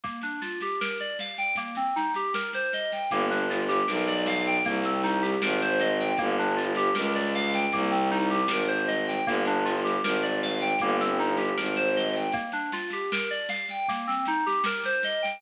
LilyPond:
<<
  \new Staff \with { instrumentName = "Electric Piano 2" } { \time 4/4 \key g \minor \tempo 4 = 78 bes16 d'16 f'16 g'16 bes'16 d''16 f''16 g''16 bes16 c'16 ees'16 g'16 bes'16 c''16 ees''16 g''16 | bes16 d'16 f'16 g'16 bes'16 d''16 f''16 g''16 bes16 c'16 ees'16 g'16 bes'16 c''16 ees''16 g''16 | bes16 d'16 f'16 g'16 bes'16 d''16 f''16 g''16 bes16 c'16 ees'16 g'16 bes'16 c''16 ees''16 g''16 | bes16 d'16 f'16 g'16 bes'16 d''16 f''16 g''16 bes16 c'16 ees'16 g'16 bes'16 c''16 ees''16 g''16 |
bes16 d'16 f'16 g'16 bes'16 d''16 f''16 g''16 bes16 c'16 ees'16 g'16 bes'16 c''16 ees''16 g''16 | }
  \new Staff \with { instrumentName = "Violin" } { \clef bass \time 4/4 \key g \minor r1 | g,,4 b,,4 c,4 aes,,4 | g,,4 des,4 c,4 aes,,4 | g,,4 aes,,4 g,,4 aes,,4 |
r1 | }
  \new DrumStaff \with { instrumentName = "Drums" } \drummode { \time 4/4 <bd sn>16 sn16 sn16 sn16 sn16 sn16 sn16 sn16 <bd sn>16 sn16 sn16 sn16 sn16 sn16 sn16 sn16 | <bd sn>16 sn16 sn16 sn16 sn16 sn16 sn16 sn16 <bd sn>16 sn16 sn16 sn16 sn16 sn16 sn16 sn16 | <bd sn>16 sn16 sn16 sn16 sn16 sn16 sn16 sn16 <bd sn>16 sn16 sn16 sn16 sn16 sn16 sn16 sn16 | <bd sn>16 sn16 sn16 sn16 sn16 sn16 sn16 sn16 <bd sn>16 sn16 sn16 sn16 sn16 sn16 sn16 sn16 |
<bd sn>16 sn16 sn16 sn16 sn16 sn16 sn16 sn16 <bd sn>16 sn16 sn16 sn16 sn16 sn16 sn16 sn16 | }
>>